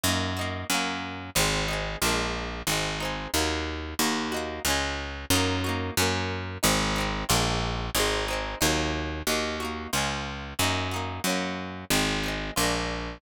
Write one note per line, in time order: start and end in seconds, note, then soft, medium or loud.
0.03 0.64 F#2 loud
0.03 0.34 D#4 loud
0.03 0.34 F#4 medium
0.08 0.34 A#3 loud
0.37 0.67 D#4 medium
0.37 0.67 F#4 medium
0.41 0.67 A#3 medium
0.70 1.30 F#2 loud
0.70 1.30 C#4 loud
0.70 1.30 F#4 medium
0.74 1.30 A#3 loud
1.35 1.96 G#1 loud
1.35 1.66 C4 loud
1.35 1.66 D#4 medium
1.40 1.66 G#3 medium
1.68 1.99 C4 medium
1.68 1.99 D#4 medium
1.73 1.99 G#3 medium
2.02 2.62 A#1 loud
2.02 2.62 D4 loud
2.02 2.62 F4 medium
2.06 2.62 G#3 medium
2.06 2.62 A#3 loud
2.67 3.27 G#1 medium
2.67 2.98 C4 medium
2.67 2.98 D#4 loud
2.72 2.98 G#3 loud
3.00 3.31 C4 medium
3.00 3.31 D#4 medium
3.05 3.31 G#3 medium
3.34 3.94 D#2 loud
3.34 3.94 A#3 loud
3.34 3.94 D#4 medium
3.38 3.94 F#3 loud
3.99 4.60 D#2 loud
3.99 4.29 D#4 loud
3.99 4.29 F#4 loud
4.04 4.29 A#3 loud
4.32 4.62 D#4 medium
4.32 4.62 F#4 loud
4.36 4.62 A#3 medium
4.65 5.25 C#2 loud
4.65 5.26 C#4 loud
4.65 5.26 F4 loud
4.70 5.26 G#3 loud
5.30 5.91 F#2 loud
5.30 5.61 D#4 loud
5.30 5.61 F#4 loud
5.36 5.61 A#3 loud
5.64 5.94 D#4 medium
5.64 5.94 F#4 medium
5.69 5.94 A#3 medium
5.97 6.58 F#2 loud
5.97 6.58 C#4 loud
5.97 6.58 F#4 medium
6.02 6.58 A#3 loud
6.63 7.24 G#1 loud
6.63 6.93 C4 loud
6.63 6.93 D#4 loud
6.67 6.93 G#3 loud
6.96 7.26 C4 medium
6.96 7.26 D#4 medium
7.00 7.26 G#3 medium
7.29 7.90 A#1 loud
7.29 7.89 D4 loud
7.29 7.89 F4 loud
7.33 7.89 G#3 loud
7.33 7.89 A#3 loud
7.95 8.55 G#1 loud
7.95 8.25 C4 loud
7.95 8.25 D#4 loud
7.99 8.25 G#3 loud
8.28 8.59 C4 medium
8.28 8.59 D#4 medium
8.33 8.59 G#3 medium
8.61 9.22 D#2 loud
8.61 9.21 A#3 loud
8.61 9.21 D#4 loud
8.65 9.21 F#3 loud
9.27 9.88 D#2 loud
9.27 9.57 D#4 medium
9.27 9.57 F#4 medium
9.31 9.57 A#3 medium
9.60 9.90 D#4 medium
9.60 9.90 F#4 medium
9.65 9.90 A#3 medium
9.93 10.54 C#2 medium
9.93 10.53 C#4 medium
9.93 10.53 F4 medium
9.97 10.53 G#3 loud
10.59 11.20 F#2 loud
10.59 10.89 D#4 loud
10.59 10.89 F#4 medium
10.63 10.89 A#3 loud
10.91 11.22 D#4 medium
10.91 11.22 F#4 medium
10.96 11.22 A#3 medium
11.24 11.85 F#2 loud
11.24 11.85 C#4 loud
11.24 11.85 F#4 medium
11.29 11.85 A#3 loud
11.90 12.51 G#1 loud
11.90 12.21 C4 loud
11.90 12.21 D#4 medium
11.95 12.21 G#3 medium
12.23 12.54 C4 medium
12.23 12.54 D#4 medium
12.28 12.54 G#3 medium
12.56 13.18 A#1 loud
12.56 13.17 D4 loud
12.56 13.17 F4 medium
12.61 13.17 G#3 medium
12.61 13.17 A#3 medium